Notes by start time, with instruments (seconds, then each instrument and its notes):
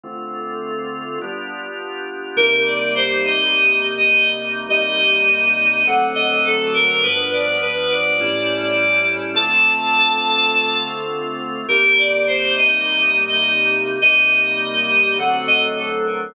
0.03 drawbar organ D3 A3 C4 F4
1.21 drawbar organ G3 B3 D4 F4
2.36 drawbar organ C3 G3 A#3 D#4, choir aahs A#4
2.51 choir aahs A#4
2.66 choir aahs D5
2.95 choir aahs C5
3.24 choir aahs D#5
3.97 choir aahs D#5
4.69 drawbar organ C3 G3 A#3 D#4, choir aahs D#5
5.86 drawbar organ D3 F#3 A3 C4, choir aahs F#5
6.15 choir aahs D#5
6.44 choir aahs A4
6.74 choir aahs A#4
6.88 choir aahs A#4
7.03 drawbar organ G2 F3 B3 D4, choir aahs B4
7.17 choir aahs B4
7.32 choir aahs D5
7.61 choir aahs B4
7.90 choir aahs D5
8.20 drawbar organ A2 G3 C#4 E4
8.63 choir aahs D5
9.34 drawbar organ D3 A3 C4 F4, choir aahs A5
9.50 choir aahs A5
11.68 drawbar organ C3 G3 A#3 D#4, choir aahs A#4
11.83 choir aahs A#4
11.98 choir aahs D5
12.27 choir aahs C5
12.56 choir aahs D#5
13.29 choir aahs D#5
14.02 drawbar organ C3 G3 A#3 D#4, choir aahs D#5
15.18 drawbar organ D3 F#3 A3 C4, choir aahs F#5
15.47 choir aahs D#5
15.76 choir aahs A4
16.06 choir aahs A#4
16.20 choir aahs A#4